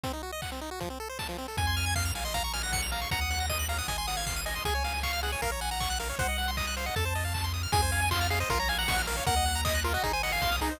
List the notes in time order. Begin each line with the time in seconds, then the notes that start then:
0.04 C4, kick, closed hi-hat
0.13 D#4
0.23 F#4
0.32 D#5
0.42 F#5, kick, clap
0.52 C4
0.61 D#4
0.71 F#4
0.80 F3, kick, closed hi-hat
0.90 C4
1.00 A4
1.09 C5
1.19 A5, kick, snare
1.29 F3
1.38 C4
1.48 A4
1.57 F2 G#5, kick, closed hi-hat
1.67 C6
1.77 F6, open hi-hat
1.86 G#6
1.96 F5 C7, kick, clap
2.05 F7
2.15 A#1 F5 G#5, open hi-hat
2.25 D#5 C6
2.34 F5 A#5, kick, closed hi-hat
2.43 A#5 C#6
2.53 G#5 F6, open hi-hat
2.63 F#5 A#6
2.72 C#7, kick, snare
2.82 F7
2.92 F5 A#5, open hi-hat
3.02 C#6
3.11 D#2 F#5 A#5, kick, closed hi-hat
3.21 D#6
3.30 F#6, open hi-hat
3.40 A#6
3.49 D#5 D#7, kick, snare
3.59 F#7
3.68 F5 A#5, open hi-hat
3.78 F#5 D#6
3.88 G#1 D#5 G#5, kick, closed hi-hat
3.98 G#5 C6
4.07 F#5 D#6, open hi-hat
4.17 F5 G#6
4.27 C7, kick, clap
4.36 D#7
4.46 D#5 G#5, open hi-hat
4.56 C6
4.65 C#2 G#4 G#5, kick, closed hi-hat
4.75 C#5
4.84 F5, open hi-hat
4.94 G#5
5.03 F5 C#6, kick, clap
5.13 F6
5.23 G#4 F#5, open hi-hat
5.32 C#5 G#5
5.42 A#1 A#4 F5, kick, closed hi-hat
5.51 C#5 A#5
5.61 F#5 G#5, open hi-hat
5.71 F#5 A#5
5.80 C#6, kick, clap
5.90 F#6
5.99 A#4 F5, open hi-hat
6.10 C#5
6.19 C2 C5 F#5, kick, closed hi-hat
6.29 D#5
6.38 F#5, open hi-hat
6.48 C6
6.57 D#5 D#6, kick, clap
6.67 F#6
6.77 C5 F5, open hi-hat
6.86 D#5 F#5
6.96 F2 A4 A5, kick, closed hi-hat
7.05 C5
7.15 D#5, open hi-hat
7.25 F5
7.34 A5, kick, clap
7.44 C6
7.54 D#6, open hi-hat
7.63 F6
7.72 F2 G#4 G#5, kick, closed hi-hat
7.82 C5
7.92 F5, open hi-hat
8.02 G#5
8.11 F4 C6, kick, clap
8.21 F6
8.30 G#4 F5, open hi-hat
8.40 C5 D#5
8.50 A#1 F4 A#4, kick, closed hi-hat
8.59 C#5 A#5
8.68 F5 G#5, open hi-hat
8.78 F#5 A#5
8.88 C#6, kick, snare
8.98 F6
9.07 A#4 F5, open hi-hat
9.17 C#5
9.26 D#2 A#4 F#5, kick, closed hi-hat
9.36 D#5
9.46 F#5, open hi-hat
9.55 A#5
9.65 D#5 D#6, kick, clap
9.75 F#6
9.84 F4 A#4, open hi-hat
9.94 F#4 D#5
10.03 G#1 D#4 G#4, kick, closed hi-hat
10.13 C5 G#5
10.23 D#5 F#5, open hi-hat
10.32 F5 G#5
10.42 B1 C6, kick, snare
10.52 D#6
10.61 C2 D#4 G#4, open hi-hat
10.71 C5